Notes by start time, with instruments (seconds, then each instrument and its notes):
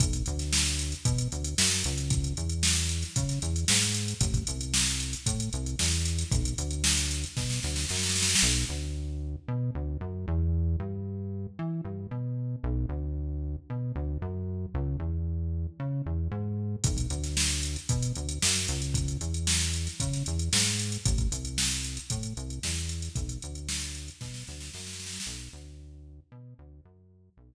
0.00 synth bass 1 B1, kick, closed hi-hat
0.13 kick, closed hi-hat
0.26 synth bass 1 D2, closed hi-hat
0.39 snare, closed hi-hat
0.53 snare
0.66 closed hi-hat
0.79 closed hi-hat
0.92 closed hi-hat
1.05 synth bass 1 B2, kick, closed hi-hat
1.18 closed hi-hat
1.32 synth bass 1 D2, closed hi-hat
1.44 closed hi-hat
1.58 synth bass 1 F#2, snare
1.72 closed hi-hat
1.84 synth bass 1 C#2, closed hi-hat
1.98 closed hi-hat
2.10 kick, closed hi-hat
2.24 closed hi-hat
2.37 synth bass 1 E2, closed hi-hat
2.49 closed hi-hat
2.63 snare
2.76 snare, closed hi-hat
2.89 closed hi-hat
3.02 snare, closed hi-hat
3.16 synth bass 1 C#3, kick, closed hi-hat
3.29 snare, closed hi-hat
3.42 synth bass 1 E2, closed hi-hat
3.56 closed hi-hat
3.68 synth bass 1 G#2, snare
3.82 closed hi-hat
3.94 closed hi-hat
4.08 closed hi-hat
4.21 synth bass 1 A1, kick, closed hi-hat
4.34 kick, closed hi-hat
4.47 synth bass 1 C2, closed hi-hat
4.61 closed hi-hat
4.74 snare
4.86 closed hi-hat
5.00 closed hi-hat
5.13 closed hi-hat
5.26 synth bass 1 A2, kick, closed hi-hat
5.40 closed hi-hat
5.53 synth bass 1 C2, closed hi-hat
5.66 closed hi-hat
5.79 synth bass 1 E2, snare
5.92 closed hi-hat
6.05 closed hi-hat
6.19 snare, closed hi-hat
6.31 synth bass 1 B1, kick, closed hi-hat
6.45 closed hi-hat
6.58 synth bass 1 D2, closed hi-hat
6.71 closed hi-hat
6.84 snare
6.97 closed hi-hat
7.11 snare, closed hi-hat
7.24 closed hi-hat
7.37 synth bass 1 B2, kick, snare
7.50 snare
7.63 synth bass 1 D2, snare
7.76 snare
7.89 synth bass 1 F#2, snare
7.96 snare
8.03 snare
8.09 snare
8.16 snare
8.22 snare
8.29 snare
8.35 snare
8.42 synth bass 1 B1
8.69 synth bass 1 D2
9.48 synth bass 1 B2
9.75 synth bass 1 D2
10.01 synth bass 1 F#2
10.28 synth bass 1 E2
10.80 synth bass 1 G2
11.59 synth bass 1 E3
11.85 synth bass 1 G2
12.11 synth bass 1 B2
12.63 synth bass 1 B1
12.89 synth bass 1 D2
13.70 synth bass 1 B2
13.96 synth bass 1 D2
14.22 synth bass 1 F#2
14.74 synth bass 1 C#2
15.00 synth bass 1 E2
15.80 synth bass 1 C#3
16.06 synth bass 1 E2
16.31 synth bass 1 G#2
16.84 synth bass 1 B1, kick, closed hi-hat
16.97 kick, closed hi-hat
17.10 synth bass 1 D2, closed hi-hat
17.24 snare, closed hi-hat
17.37 snare
17.50 closed hi-hat
17.63 closed hi-hat
17.76 closed hi-hat
17.89 synth bass 1 B2, kick, closed hi-hat
18.03 closed hi-hat
18.15 synth bass 1 D2, closed hi-hat
18.29 closed hi-hat
18.42 synth bass 1 F#2, snare
18.55 closed hi-hat
18.68 synth bass 1 C#2, closed hi-hat
18.82 closed hi-hat
18.94 kick, closed hi-hat
19.08 closed hi-hat
19.21 synth bass 1 E2, closed hi-hat
19.34 closed hi-hat
19.47 snare
19.61 snare, closed hi-hat
19.73 closed hi-hat
19.87 snare, closed hi-hat
20.00 synth bass 1 C#3, kick, closed hi-hat
20.13 snare, closed hi-hat
20.26 synth bass 1 E2, closed hi-hat
20.39 closed hi-hat
20.53 synth bass 1 G#2, snare
20.66 closed hi-hat
20.79 closed hi-hat
20.92 closed hi-hat
21.05 synth bass 1 A1, kick, closed hi-hat
21.18 kick, closed hi-hat
21.32 synth bass 1 C2, closed hi-hat
21.45 closed hi-hat
21.58 snare
21.71 closed hi-hat
21.84 closed hi-hat
21.97 closed hi-hat
22.10 synth bass 1 A2, kick, closed hi-hat
22.23 closed hi-hat
22.37 synth bass 1 C2, closed hi-hat
22.50 closed hi-hat
22.63 synth bass 1 E2, snare
22.76 closed hi-hat
22.89 closed hi-hat
23.02 snare, closed hi-hat
23.15 synth bass 1 B1, kick, closed hi-hat
23.29 closed hi-hat
23.42 synth bass 1 D2, closed hi-hat
23.55 closed hi-hat
23.69 snare
23.81 closed hi-hat
23.94 snare, closed hi-hat
24.08 closed hi-hat
24.21 synth bass 1 B2, kick, snare
24.34 snare
24.47 synth bass 1 D2, snare
24.60 snare
24.73 synth bass 1 F#2, snare
24.80 snare
24.87 snare
24.93 snare
25.00 snare
25.06 snare
25.13 snare
25.20 snare
25.26 synth bass 1 B1
25.53 synth bass 1 D2
26.32 synth bass 1 B2
26.59 synth bass 1 D2
26.85 synth bass 1 F#2
27.37 synth bass 1 B1